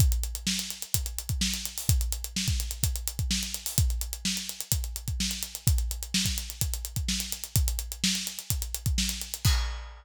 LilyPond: \new DrumStaff \drummode { \time 4/4 \tempo 4 = 127 <hh bd>16 hh16 hh16 hh16 sn16 hh16 hh16 hh16 <hh bd>16 hh16 hh16 <hh bd>16 sn16 hh16 hh16 hho16 | <hh bd>16 hh16 hh16 hh16 sn16 <hh bd>16 hh16 hh16 <hh bd>16 hh16 hh16 <hh bd>16 sn16 hh16 hh16 hho16 | <hh bd>16 hh16 hh16 hh16 sn16 hh16 hh16 hh16 <hh bd>16 hh16 hh16 <hh bd>16 sn16 hh16 hh16 hh16 | <hh bd>16 hh16 hh16 hh16 sn16 <hh bd>16 hh16 hh16 <hh bd>16 hh16 hh16 <hh bd>16 sn16 hh16 hh16 hh16 |
<hh bd>16 hh16 hh16 hh16 sn16 hh16 hh16 hh16 <hh bd>16 hh16 hh16 <hh bd>16 sn16 hh16 hh16 hh16 | <cymc bd>4 r4 r4 r4 | }